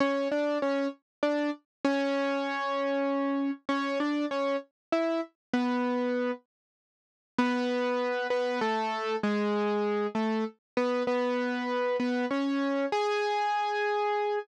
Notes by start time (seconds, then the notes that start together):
0.00 C#4 C#5
0.32 D4 D5
0.62 C#4 C#5
1.23 D4 D5
1.85 C#4 C#5
3.69 C#4 C#5
4.00 D4 D5
4.31 C#4 C#5
4.92 E4 E5
5.53 B3 B4
7.38 B3 B4
8.30 B3 B4
8.61 A3 A4
9.23 G#3 G#4
10.15 A3 A4
10.77 B3 B4
11.07 B3 B4
12.00 B3 B4
12.31 C#4 C#5
12.92 G#4 G#5